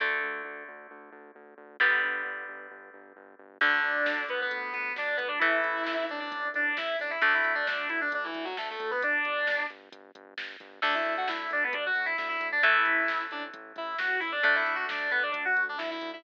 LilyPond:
<<
  \new Staff \with { instrumentName = "Distortion Guitar" } { \time 4/4 \key d \major \tempo 4 = 133 r1 | r1 | <d' d''>4. <b b'>16 <b b'>8. <b b'>8 <d' d''>8 <b b'>16 <d' d''>16 | <e' e''>4. <d' d''>16 <d' d''>8. <d' d''>8 <e' e''>8 <d' d''>16 <e' e''>16 |
<d' d''>16 <e' e''>8 <d' d''>16 <d' d''>8 <e' e''>16 <d' d''>16 <d' d''>16 <e e'>8 <fis fis'>16 <a a'>16 <a a'>8 <b b'>16 | <d' d''>4. r2 r8 | <d' d''>16 <e' e''>8 <fis' fis''>16 <e' e''>8 <d' d''>16 <b b'>16 <d' d''>16 <fis' fis''>8 <e' e''>16 <e' e''>16 <e' e''>8 <d' d''>16 | <e' e''>4. <d' d''>16 r8. <e' e''>8 <fis' fis''>8 <e' e''>16 <d' d''>16 |
<d' d''>16 <e' e''>8 <fis' fis''>16 <d' d''>8 <b b'>16 <d' d''>16 <d' d''>16 <fis' fis''>8 <d' d''>16 <e' e''>16 <e' e''>8 <e' e''>16 | }
  \new Staff \with { instrumentName = "Overdriven Guitar" } { \time 4/4 \key d \major <d a>1 | <d g b>1 | <d a>1 | <e a>1 |
<d a>1 | r1 | <d a>1 | <e a>1 |
<d a>1 | }
  \new Staff \with { instrumentName = "Synth Bass 1" } { \clef bass \time 4/4 \key d \major d,8 d,8 d,8 d,8 d,8 d,8 d,8 d,8 | g,,8 g,,8 g,,8 g,,8 g,,8 g,,8 g,,8 g,,8 | d,8 d,8 d,8 d,8 d,8 d,8 d,8 d,8 | a,,8 a,,8 a,,8 a,,8 a,,8 a,,8 a,,8 a,,8 |
d,8 d,8 d,8 d,8 d,8 d,8 d,8 d,8 | g,,8 g,,8 g,,8 g,,8 g,,8 g,,8 g,,8 g,,8 | d,8 d,8 d,8 d,8 d,8 d,8 d,8 d,8 | a,,8 a,,8 a,,8 a,,8 a,,8 a,,8 a,,8 a,,8 |
d,8 d,8 d,8 d,8 d,8 d,8 d,8 d,8 | }
  \new DrumStaff \with { instrumentName = "Drums" } \drummode { \time 4/4 r4 r4 r4 r4 | r4 r4 r4 r4 | <cymc bd>8 hh8 sn8 hh8 <hh bd>8 <hh bd>8 sn8 <hh bd>8 | <hh bd>8 hh8 sn8 hh8 <hh bd>8 <hh bd>8 sn8 hho8 |
<hh bd>8 hh8 sn8 hh8 <hh bd>8 <hh bd>8 sn8 <hh bd>8 | <hh bd>8 hh8 sn8 hh8 <hh bd>8 <hh bd>8 sn8 <hh bd>8 | <cymc bd>8 hh8 sn8 hh8 <hh bd>8 <hh bd>8 sn8 <hh bd>8 | <hh bd>8 hh8 sn8 hh8 <hh bd>8 <hh bd>8 sn8 hho8 |
<hh bd>8 hh8 sn8 hh8 <hh bd>8 <hh bd>8 sn8 <hh bd>8 | }
>>